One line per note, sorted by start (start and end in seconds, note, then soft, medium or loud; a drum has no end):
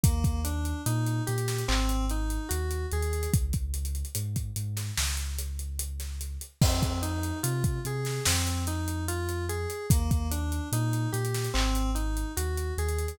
0.03 0.73 D#2 loud
0.03 0.41 A#3 medium
0.03 kick loud
0.03 closed hi-hat loud
0.24 kick loud
0.24 closed hi-hat medium
0.44 0.81 D4 medium
0.44 closed hi-hat loud
0.65 closed hi-hat medium
0.86 1.21 A#2 loud
0.86 1.23 D#4 medium
0.86 closed hi-hat loud
1.06 closed hi-hat medium
1.27 1.63 A#2 medium
1.27 1.64 G4 medium
1.27 closed hi-hat loud
1.38 closed hi-hat medium
1.48 snare medium
1.48 closed hi-hat medium
1.58 closed hi-hat medium
1.68 2.38 G#1 loud
1.68 2.05 C4 medium
1.68 clap loud
1.89 closed hi-hat medium
2.09 2.48 D#4 medium
2.09 closed hi-hat medium
2.30 closed hi-hat medium
2.49 2.85 D#2 medium
2.49 2.86 F#4 medium
2.49 closed hi-hat loud
2.71 closed hi-hat medium
2.91 3.27 D#2 medium
2.91 3.30 G#4 medium
2.91 closed hi-hat medium
3.02 closed hi-hat medium
3.13 closed hi-hat medium
3.23 closed hi-hat medium
3.33 4.03 C#2 loud
3.33 kick loud
3.33 closed hi-hat loud
3.53 kick medium
3.53 closed hi-hat medium
3.74 closed hi-hat loud
3.85 closed hi-hat medium
3.95 closed hi-hat medium
4.05 closed hi-hat medium
4.15 4.50 G#2 medium
4.15 closed hi-hat loud
4.36 kick medium
4.36 closed hi-hat medium
4.56 4.91 G#2 medium
4.56 closed hi-hat loud
4.77 snare medium
4.77 closed hi-hat medium
4.97 6.37 C#2 medium
4.97 snare loud
5.17 closed hi-hat medium
5.39 closed hi-hat loud
5.59 closed hi-hat medium
5.79 closed hi-hat loud
6.00 snare soft
6.00 closed hi-hat medium
6.21 closed hi-hat medium
6.41 closed hi-hat medium
6.61 7.32 F2 loud
6.61 6.99 C4 loud
6.61 kick loud
6.61 crash loud
6.82 kick medium
6.82 closed hi-hat medium
7.02 7.39 D#4 medium
7.02 closed hi-hat medium
7.23 closed hi-hat medium
7.43 7.78 C3 medium
7.43 7.80 F4 medium
7.43 closed hi-hat loud
7.64 kick loud
7.64 closed hi-hat medium
7.85 8.20 C3 medium
7.85 8.23 G#4 medium
7.85 closed hi-hat medium
8.05 snare medium
8.05 closed hi-hat medium
8.25 9.66 F2 medium
8.25 8.64 C4 medium
8.25 snare loud
8.47 closed hi-hat medium
8.67 9.04 D#4 medium
8.67 closed hi-hat loud
8.88 closed hi-hat medium
9.08 9.45 F4 medium
9.08 closed hi-hat loud
9.29 closed hi-hat medium
9.49 9.86 G#4 medium
9.49 closed hi-hat medium
9.70 closed hi-hat medium
9.90 10.60 D#2 loud
9.90 10.28 A#3 medium
9.90 kick loud
9.90 closed hi-hat loud
10.11 kick loud
10.11 closed hi-hat medium
10.31 10.68 D4 medium
10.31 closed hi-hat loud
10.52 closed hi-hat medium
10.72 11.07 A#2 loud
10.72 11.10 D#4 medium
10.72 closed hi-hat loud
10.93 closed hi-hat medium
11.12 11.48 A#2 medium
11.12 11.49 G4 medium
11.12 closed hi-hat loud
11.25 closed hi-hat medium
11.34 snare medium
11.34 closed hi-hat medium
11.44 closed hi-hat medium
11.54 12.24 G#1 loud
11.54 11.91 C4 medium
11.54 clap loud
11.75 closed hi-hat medium
11.95 12.32 D#4 medium
11.95 closed hi-hat medium
12.17 closed hi-hat medium
12.37 12.72 D#2 medium
12.37 12.74 F#4 medium
12.37 closed hi-hat loud
12.57 closed hi-hat medium
12.78 13.13 D#2 medium
12.78 13.16 G#4 medium
12.78 closed hi-hat medium
12.89 closed hi-hat medium
12.98 closed hi-hat medium
13.08 closed hi-hat medium